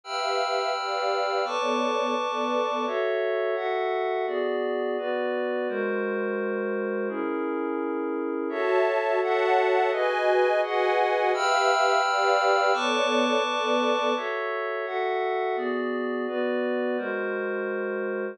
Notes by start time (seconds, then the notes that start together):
0.04 G4 B4 E5 F5 G5 B5 E6 F6
0.76 G4 B4 D5 F5
1.44 B3 A4 B4 C#5 D5 A5 C#6 D6
2.16 B3 A4 B4 D5
2.87 F#4 A4 C#5 E5
3.55 F#4 A4 E5 F#5
4.27 B3 F#4 G#4 D5
4.98 B3 F#4 B4 D5
5.69 G#3 F#4 A#4 C5
7.09 C#4 E4 G#4 A#4
8.49 F#4 A4 C#5 E5 A5
9.21 F#4 A4 C#5 E5 F#5 A5
9.91 F#4 G#4 B4 D#5 G#5
10.62 F#4 G#4 B4 D#5 F#5 G#5
11.32 G4 B4 E5 F5 G5 B5 E6 F6
12.02 G4 B4 D5 F5
12.73 B3 A4 B4 C#5 D5 A5 C#6 D6
13.43 B3 A4 B4 D5
14.16 F#4 A4 C#5 E5
14.86 F#4 A4 E5 F#5
15.56 B3 F#4 G#4 D5
16.27 B3 F#4 B4 D5
16.97 G#3 F#4 A#4 C5